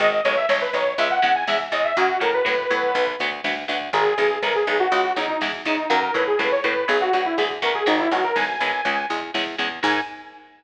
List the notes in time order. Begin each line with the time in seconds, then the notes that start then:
0.00 G#1 D#3 G#3 D#5, kick, closed hi-hat
0.12 D#5, kick
0.24 B1 D#3 G#3 C#5, kick, closed hi-hat
0.37 E5, kick
0.49 B1 D#3 G#3 C#5, kick, snare
0.61 B4, kick
0.73 B1 D#3 G#3 C#5, kick, closed hi-hat
0.86 kick
0.98 C#2 C#3 G#3 E5, kick, closed hi-hat
1.10 F#5, kick
1.22 E2 C#3 G#3 F#5, kick, closed hi-hat
1.35 G#5, kick
1.47 E2 C#3 G#3 E5, kick, snare
1.60 kick
1.72 E2 C#3 G#3 D#5, kick, closed hi-hat
1.84 E5, kick
1.97 F#2 C#3 F#3 A#3 F#4, kick, closed hi-hat
2.09 kick
2.20 A2 C#3 F#3 A#3 A#4, kick, closed hi-hat
2.34 B4, kick
2.45 A2 C#3 F#3 A#3, kick, snare
2.58 kick
2.70 A2 F#3 B3, kick, closed hi-hat
2.83 kick
2.95 B1, kick, closed hi-hat
3.07 kick
3.19 D2 F#3 B3, kick, closed hi-hat
3.32 kick
3.44 D2 F#3 B3, kick, snare
3.57 kick
3.68 D2 F#3 B3, kick, closed hi-hat
3.81 kick
3.93 G#1 D#3 G#3 G#4, kick, closed hi-hat
4.06 kick
4.18 B1 D#3 G#3, kick, closed hi-hat
4.31 kick
4.43 B1 D#3 G#3 A#4, kick, snare
4.55 G#4, kick
4.67 B1 D#3 G#3, kick, closed hi-hat
4.80 F#4, kick
4.92 C#2 C#3 G#3, kick, closed hi-hat
5.04 kick
5.16 E2 C#3 G#3 D#4, kick, closed hi-hat
5.28 D#4, kick
5.41 E2 C#3 G#3, kick, snare
5.53 kick
5.65 E2 C#3 G#3 D#4, kick, closed hi-hat
5.78 kick
5.90 F#2 C#3 F#3 A#3 A#4, kick, closed hi-hat
6.02 A#4, kick
6.14 A2 C#3 F#3 A#3 B4, kick, closed hi-hat
6.27 G#4, kick
6.39 A2 C#3 F#3 A#3 B4, kick, snare
6.51 C#5, kick
6.64 A2 C#3 F#3 A#3 B4, kick, closed hi-hat
6.76 kick
6.88 B1 F#3 B3 G#4, kick, closed hi-hat
7.01 F#4, kick
7.13 D2 F#3 B3 F#4, kick, closed hi-hat
7.25 E4, kick
7.38 D2 F#3 B3 G#4, kick, snare
7.50 kick
7.62 D2 F#3 B3 A#4, kick, closed hi-hat
7.75 G#4, kick
7.86 G#1 D#3 G#3 D#4, kick, closed hi-hat
7.99 E4, kick
8.11 B1 D#3 G#3 F#4, kick, closed hi-hat
8.24 A#4, kick
8.36 B1 D#3 G#3 G#5, kick, snare
8.48 kick
8.60 B1 D#3 G#3, kick, closed hi-hat
8.73 kick
8.85 C#2 C#3 G#3, kick, closed hi-hat
8.97 kick
9.10 E2 C#3 G#3, kick, closed hi-hat
9.22 kick
9.34 E2 C#3 G#3, kick, snare
9.47 kick
9.58 E2 C#3 G#3, kick, closed hi-hat
9.71 kick
9.83 G#2 D#3 G#3 G#5, kick, crash